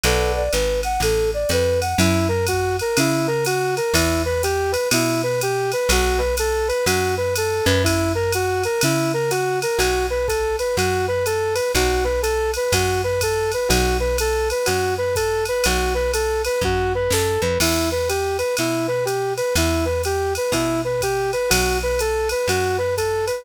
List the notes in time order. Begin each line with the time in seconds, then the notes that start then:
0.04 B1 A4 B4 D5 F#5, ride
0.36 D5
0.53 G#1 B4, hi-hat pedal, ride
0.83 F#5, ride
1.00 A1 A4, ride
1.34 D5
1.49 F2 B4, hi-hat pedal, ride
1.81 F#5, ride
1.98 F#2 E4, ride
2.28 A#4
2.47 F#4, kick, hi-hat pedal, ride
2.79 A#4, ride
2.97 C#3 E4, ride
3.27 A#4
3.45 F#4, hi-hat pedal, ride
3.77 A#4, ride
3.94 E2 E4, kick, ride
4.25 B4
4.43 G4, hi-hat pedal, ride
4.72 B4, ride
4.91 B2 E4, ride
5.23 B4
5.41 G4, hi-hat pedal, ride
5.72 B4, ride
5.89 B1 F#4, kick, ride
6.18 B4
6.37 A4, hi-hat pedal, ride
6.68 B4, ride
6.86 F#2 F#4, ride
7.17 B4
7.36 A4, hi-hat pedal, ride
7.65 F#2 B4, ride
7.84 E4, kick, ride
8.15 A#4
8.32 F#4, hi-hat pedal, ride
8.64 A#4, ride
8.81 C#3 E4, ride
9.14 A#4
9.31 F#4, hi-hat pedal, ride
9.62 A#4, ride
9.78 B1 F#4, ride
10.10 B4
10.28 A4, kick, hi-hat pedal, ride
10.59 B4, ride
10.77 F#2 F#4, ride
11.08 B4
11.26 A4, hi-hat pedal, ride
11.55 B4, ride
11.74 B1 F#4, kick, ride
12.04 B4
12.22 A4, hi-hat pedal, ride
12.54 B4, ride
12.72 F#2 F#4, kick, ride
13.04 B4
13.21 A4, kick, hi-hat pedal, ride
13.52 B4, ride
13.68 B1 F#4, ride
14.00 B4
14.18 A4, hi-hat pedal, ride
14.50 B4, ride
14.66 F#2 F#4, ride
14.98 B4
15.16 A4, kick, hi-hat pedal, ride
15.45 B4, ride
15.64 B1 F#4, ride
15.95 B4
16.14 A4, hi-hat pedal, ride
16.45 B4, ride
16.61 F#2 F#4, kick
16.95 B4
17.10 F#2 A4, snare
17.41 F2 B4
17.60 E2 E4, crash, ride
17.92 B4
18.09 G4, hi-hat pedal, ride
18.38 B4, ride
18.57 B2 E4, ride
18.88 B4
19.05 G4, hi-hat pedal, ride
19.37 B4, ride
19.55 E2 E4, ride
19.85 B4
20.04 G4, hi-hat pedal, ride
20.35 B4, ride
20.52 B2 E4, kick, ride
20.85 B4
21.01 G4, kick, hi-hat pedal, ride
21.33 B4, ride
21.50 B1 F#4, ride
21.83 B4
21.99 A4, hi-hat pedal, ride
22.29 B4, ride
22.48 F#2 F#4, ride
22.78 B4
22.97 A4, kick, hi-hat pedal, ride
23.27 B4, ride